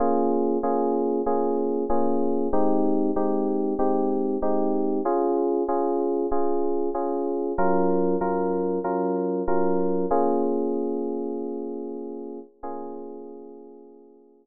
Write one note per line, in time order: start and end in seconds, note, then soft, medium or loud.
0.00 0.58 A#3 loud
0.00 0.58 C#4 medium
0.00 0.58 F4 medium
0.00 0.58 G#4 medium
0.63 1.21 A#3 medium
0.63 1.21 C#4 medium
0.63 1.21 F4 medium
0.63 1.21 G#4 medium
1.26 1.84 A#3 medium
1.26 1.84 C#4 medium
1.26 1.84 F4 medium
1.26 1.84 G#4 medium
1.90 2.48 A#3 medium
1.90 2.48 C#4 medium
1.90 2.48 F4 medium
1.90 2.48 G#4 medium
2.53 3.11 G#3 medium
2.53 3.11 C4 medium
2.53 3.11 D#4 loud
2.53 3.11 G4 medium
3.16 3.74 G#3 medium
3.16 3.74 C4 medium
3.16 3.74 D#4 medium
3.16 3.74 G4 medium
3.79 4.37 G#3 medium
3.79 4.37 C4 medium
3.79 4.37 D#4 medium
3.79 4.37 G4 medium
4.42 5.00 G#3 medium
4.42 5.00 C4 medium
4.42 5.00 D#4 medium
4.42 5.00 G4 medium
5.05 5.63 C#4 medium
5.05 5.63 F4 loud
5.05 5.63 G#4 medium
5.68 6.26 C#4 medium
5.68 6.26 F4 medium
5.68 6.26 G#4 medium
6.31 6.89 C#4 medium
6.31 6.89 F4 medium
6.31 6.89 G#4 medium
6.94 7.53 C#4 medium
6.94 7.53 F4 medium
6.94 7.53 G#4 medium
7.58 8.16 F#3 loud
7.58 8.16 C#4 medium
7.58 8.16 F4 loud
7.58 8.16 A#4 medium
8.21 8.79 F#3 medium
8.21 8.79 C#4 medium
8.21 8.79 F4 medium
8.21 8.79 A#4 medium
8.84 9.42 F#3 medium
8.84 9.42 C#4 medium
8.84 9.42 F4 medium
8.84 9.42 A#4 medium
9.48 10.06 F#3 medium
9.48 10.06 C#4 medium
9.48 10.06 F4 medium
9.48 10.06 A#4 medium
10.11 12.39 A#3 loud
10.11 12.39 C#4 loud
10.11 12.39 F4 medium
10.11 12.39 G#4 medium
12.63 14.46 A#3 medium
12.63 14.46 C#4 loud
12.63 14.46 F4 medium
12.63 14.46 G#4 loud